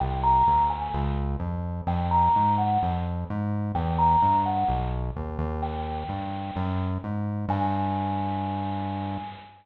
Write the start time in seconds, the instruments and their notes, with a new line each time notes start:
0.00 synth bass 1 C2, tubular bells G5
0.23 tubular bells A#5
0.47 synth bass 1 D2
0.70 tubular bells G#5
0.94 synth bass 1 C#2
1.39 synth bass 1 F2
1.87 synth bass 1 F2, tubular bells G5
2.11 tubular bells A#5
2.36 synth bass 1 G#2
2.58 tubular bells F#5
2.83 synth bass 1 F2
3.30 synth bass 1 G#2
3.75 synth bass 1 E2, tubular bells G5
3.99 tubular bells A#5
4.22 synth bass 1 G2
4.46 tubular bells F#5
4.68 synth bass 1 B1
5.16 synth bass 1 D#2
5.38 synth bass 1 D#2
5.62 tubular bells G5
6.09 synth bass 1 G2
6.56 synth bass 1 F#2
7.04 synth bass 1 G#2
7.48 synth bass 1 G2, tubular bells G#5